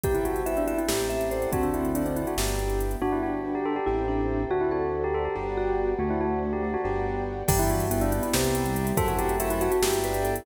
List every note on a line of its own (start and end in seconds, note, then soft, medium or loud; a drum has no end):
0.03 0.76 C2 medium
0.03 0.88 B3 medium
0.03 0.88 C4 medium
0.03 0.88 E4 medium
0.03 0.88 G4 medium
0.03 0.14 G4 medium
0.03 0.40 G4 medium
0.03 0.43 B4 medium
0.03 0.43 C5 medium
0.03 0.43 E5 medium
0.03 0.43 G5 loud
0.03 kick loud
0.03 closed hi-hat loud
0.14 0.25 E4 medium
0.14 closed hi-hat medium
0.25 0.44 F#4 medium
0.25 closed hi-hat medium
0.36 closed hi-hat medium
0.46 0.56 E4 medium
0.46 0.85 B4 medium
0.46 0.85 C5 medium
0.46 0.65 E5 medium
0.46 0.85 E5 medium
0.46 0.85 G5 medium
0.46 closed hi-hat loud
0.57 0.67 D4 medium
0.57 closed hi-hat medium
0.67 0.78 E4 medium
0.67 0.78 E5 medium
0.67 closed hi-hat medium
0.78 0.88 E4 medium
0.78 closed hi-hat medium
0.88 1.47 A1 medium
0.88 1.52 A3 medium
0.88 1.52 C4 medium
0.88 1.52 E4 medium
0.88 1.07 G4 medium
0.88 1.49 G4 medium
0.88 1.52 G4 medium
0.88 1.29 A4 loud
0.88 1.29 C5 medium
0.88 1.29 E5 medium
0.88 1.29 G5 medium
0.88 snare loud
0.99 closed hi-hat medium
1.10 1.29 E5 medium
1.10 closed hi-hat medium
1.21 closed hi-hat medium
1.31 1.91 A4 loud
1.31 1.51 C5 medium
1.31 1.91 C5 medium
1.31 1.91 D5 medium
1.31 1.91 F#5 medium
1.31 closed hi-hat medium
1.42 closed hi-hat medium
1.52 2.25 D2 medium
1.52 2.37 A3 medium
1.52 2.03 C4 medium
1.52 2.37 C4 medium
1.52 2.37 D4 medium
1.52 2.37 F#4 medium
1.52 1.63 F#4 medium
1.52 kick loud
1.52 closed hi-hat loud
1.63 1.73 D4 medium
1.63 closed hi-hat medium
1.74 1.94 E4 medium
1.74 closed hi-hat medium
1.85 closed hi-hat medium
1.95 2.05 D4 medium
1.95 2.34 A4 medium
1.95 2.34 C5 medium
1.95 2.34 D5 medium
1.95 2.34 F#5 medium
1.95 closed hi-hat loud
2.06 2.16 C4 medium
2.06 closed hi-hat medium
2.16 2.27 E4 medium
2.16 closed hi-hat medium
2.27 2.37 F#4 medium
2.27 closed hi-hat medium
2.37 2.96 G1 medium
2.37 3.01 B3 medium
2.37 3.01 D4 medium
2.37 3.01 E4 medium
2.37 3.01 G4 medium
2.37 2.79 G4 medium
2.37 2.95 B4 loud
2.37 2.95 D5 medium
2.37 2.95 E5 medium
2.37 2.95 G5 medium
2.37 snare loud
2.48 closed hi-hat medium
2.59 closed hi-hat medium
2.70 closed hi-hat medium
2.80 closed hi-hat medium
2.91 closed hi-hat medium
3.01 3.80 G1 medium
3.01 3.20 B3 loud
3.01 3.77 D4 loud
3.01 3.12 F#4 loud
3.01 3.86 B4 medium
3.01 3.86 D5 medium
3.01 3.86 F#5 medium
3.01 3.86 G5 medium
3.12 3.22 E4 medium
3.23 3.43 D4 medium
3.23 3.41 F#4 medium
3.45 3.64 F#4 medium
3.55 3.65 G4 medium
3.65 3.86 G4 medium
3.65 3.76 A4 medium
3.76 3.86 G4 medium
3.86 4.46 A1 medium
3.86 4.45 A3 medium
3.86 4.45 C4 loud
3.86 4.05 E4 medium
3.86 4.45 E4 loud
3.86 4.44 G4 medium
3.86 4.45 G4 loud
3.86 4.50 A4 medium
3.86 4.50 C5 medium
3.86 4.50 E5 medium
3.86 4.50 G5 medium
4.08 4.42 D4 medium
4.50 5.28 D2 medium
4.50 4.70 A3 loud
4.50 4.61 F#4 medium
4.50 4.70 F#4 medium
4.50 5.35 A4 medium
4.50 5.35 C5 medium
4.50 5.35 D5 medium
4.50 5.35 F#5 medium
4.61 4.71 E4 medium
4.71 4.90 C4 medium
4.71 4.92 F#4 medium
4.71 5.22 A4 medium
4.93 5.12 D4 medium
5.04 5.14 G4 medium
5.14 5.33 F#4 medium
5.14 5.24 A4 medium
5.25 5.35 G4 medium
5.36 5.95 G1 medium
5.36 5.93 B3 loud
5.36 5.93 D4 loud
5.36 5.93 F#4 loud
5.36 5.91 G4 medium
5.36 5.93 G4 loud
5.36 5.99 B4 medium
5.36 5.99 D5 medium
5.36 5.99 F#5 medium
5.36 5.99 G5 medium
5.57 5.94 F#4 medium
5.98 6.77 D2 medium
5.98 6.77 A3 loud
5.98 6.19 A3 loud
5.98 6.10 F#4 medium
5.98 6.84 A4 medium
5.98 6.84 C5 medium
5.98 6.84 D5 medium
5.98 6.84 F#5 medium
6.10 6.20 E4 medium
6.21 6.40 C4 medium
6.21 6.39 F#4 medium
6.43 6.62 D4 medium
6.53 6.63 G4 medium
6.63 6.83 F#4 medium
6.63 6.73 G4 medium
6.74 6.84 F#4 medium
6.84 7.43 G1 loud
6.84 7.42 B3 loud
6.84 7.42 D4 loud
6.84 7.42 F#4 loud
6.84 7.20 G4 medium
6.84 7.42 G4 loud
6.84 7.48 B4 medium
6.84 7.48 D5 medium
6.84 7.48 F#5 medium
6.84 7.48 G5 medium
7.48 8.21 G1 loud
7.48 7.86 E3 loud
7.48 8.33 B3 loud
7.48 8.33 D4 medium
7.48 8.33 E4 loud
7.48 7.59 G4 loud
7.48 8.33 G4 medium
7.48 7.86 B4 loud
7.48 7.86 D5 loud
7.48 7.86 E5 loud
7.48 7.86 G5 loud
7.48 kick loud
7.48 crash loud
7.59 7.69 E4 loud
7.59 closed hi-hat loud
7.70 7.87 F#4 medium
7.70 closed hi-hat loud
7.80 closed hi-hat loud
7.91 8.22 B3 loud
7.91 8.01 E4 loud
7.91 8.30 B4 loud
7.91 8.30 D5 loud
7.91 8.30 E5 loud
7.91 8.30 G5 loud
7.91 closed hi-hat loud
8.01 8.11 D4 loud
8.01 closed hi-hat loud
8.12 8.22 E4 loud
8.12 closed hi-hat loud
8.23 8.52 B3 loud
8.23 8.33 E4 loud
8.23 closed hi-hat loud
8.34 8.93 C2 loud
8.34 8.97 B3 loud
8.34 8.97 C4 medium
8.34 8.97 E4 medium
8.34 8.86 G4 loud
8.34 8.97 G4 loud
8.34 8.91 B4 loud
8.34 8.91 C5 loud
8.34 8.91 E5 loud
8.34 8.91 G5 loud
8.34 snare loud
8.44 closed hi-hat loud
8.54 8.64 B3 loud
8.54 closed hi-hat loud
8.66 8.75 G3 loud
8.66 closed hi-hat loud
8.76 8.95 G3 loud
8.76 closed hi-hat loud
8.87 closed hi-hat loud
8.97 9.69 F#2 loud
8.97 9.82 A3 loud
8.97 9.82 C4 medium
8.97 9.82 E4 loud
8.97 9.35 F#4 loud
8.97 9.82 F#4 loud
8.97 9.35 A4 loud
8.97 9.07 A4 loud
8.97 9.35 C5 loud
8.97 9.35 E5 loud
8.97 9.35 F#5 loud
8.97 kick loud
8.97 closed hi-hat loud
9.08 9.18 F#4 medium
9.08 closed hi-hat loud
9.19 9.36 G4 loud
9.19 closed hi-hat loud
9.29 closed hi-hat loud
9.40 9.50 F#4 medium
9.40 9.78 A4 loud
9.40 9.78 C5 loud
9.40 9.78 E5 loud
9.40 9.59 E5 loud
9.40 9.78 F#5 loud
9.40 closed hi-hat loud
9.50 9.60 E4 loud
9.50 closed hi-hat loud
9.60 9.71 F#4 loud
9.60 9.70 E5 loud
9.60 closed hi-hat loud
9.72 9.82 F#4 loud
9.72 closed hi-hat loud
9.82 10.41 G1 loud
9.82 10.46 B3 medium
9.82 10.46 D4 medium
9.82 10.46 E4 loud
9.82 9.99 G4 loud
9.82 10.35 G4 medium
9.82 10.46 G4 medium
9.82 10.41 B4 loud
9.82 10.41 D5 loud
9.82 10.41 E5 loud
9.82 10.41 G5 loud
9.82 snare loud
9.93 closed hi-hat loud
10.04 10.23 B4 loud
10.04 closed hi-hat loud
10.14 closed hi-hat loud
10.24 10.45 A4 loud
10.24 closed hi-hat loud
10.36 closed hi-hat loud